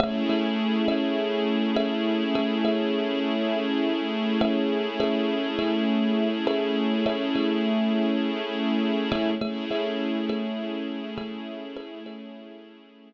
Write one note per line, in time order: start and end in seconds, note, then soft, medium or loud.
0.00 0.24 A3 loud
0.00 9.31 A3 medium
0.00 9.31 C#4 medium
0.00 9.31 E4 medium
0.00 0.24 G#4 medium
0.00 9.31 G#4 medium
0.00 0.24 C#5 loud
0.00 0.24 E5 medium
0.29 0.76 A3 medium
0.29 0.76 G#4 medium
0.29 0.76 C#5 medium
0.29 0.76 E5 medium
0.88 1.59 A3 medium
0.88 1.59 G#4 medium
0.88 1.59 C#5 medium
0.88 1.59 E5 medium
1.76 2.24 A3 medium
1.76 2.24 G#4 medium
1.76 2.24 C#5 medium
1.76 2.24 E5 medium
2.35 2.59 A3 medium
2.35 2.59 G#4 medium
2.35 2.59 C#5 medium
2.35 2.59 E5 medium
2.65 3.59 A3 medium
2.65 3.59 G#4 medium
2.65 3.59 C#5 medium
2.65 3.59 E5 medium
4.41 4.88 A3 medium
4.41 4.88 G#4 medium
4.41 4.88 C#5 medium
4.41 4.88 E5 medium
5.00 5.47 A3 medium
5.00 5.47 G#4 medium
5.00 5.47 C#5 medium
5.00 5.47 E5 medium
5.59 6.29 A3 medium
5.59 6.29 G#4 medium
5.59 6.29 C#5 medium
5.59 6.29 E5 medium
6.47 6.94 A3 medium
6.47 6.94 G#4 medium
6.47 6.94 C#5 medium
6.47 6.94 E5 medium
7.06 7.29 A3 medium
7.06 7.29 G#4 medium
7.06 7.29 C#5 medium
7.06 7.29 E5 medium
7.35 8.29 A3 medium
7.35 8.29 G#4 medium
7.35 8.29 C#5 medium
7.35 8.29 E5 medium
9.12 9.35 A3 medium
9.12 9.35 G#4 medium
9.12 9.35 C#5 medium
9.12 9.35 E5 medium
9.41 9.65 A3 medium
9.41 13.13 A3 medium
9.41 13.13 C#4 medium
9.41 13.13 E4 medium
9.41 9.65 G#4 medium
9.41 13.13 G#4 medium
9.41 9.65 C#5 medium
9.41 9.65 E5 medium
9.71 10.18 A3 medium
9.71 10.18 G#4 medium
9.71 10.18 C#5 medium
9.71 10.18 E5 medium
10.29 11.00 A3 medium
10.29 11.00 G#4 medium
10.29 11.00 C#5 medium
10.29 11.00 E5 medium
11.18 11.65 A3 medium
11.18 11.65 G#4 medium
11.18 11.65 C#5 medium
11.18 11.65 E5 medium
11.76 12.00 A3 medium
11.76 12.00 G#4 medium
11.76 12.00 C#5 medium
11.76 12.00 E5 medium
12.06 13.00 A3 medium
12.06 13.00 G#4 medium
12.06 13.00 C#5 medium
12.06 13.00 E5 medium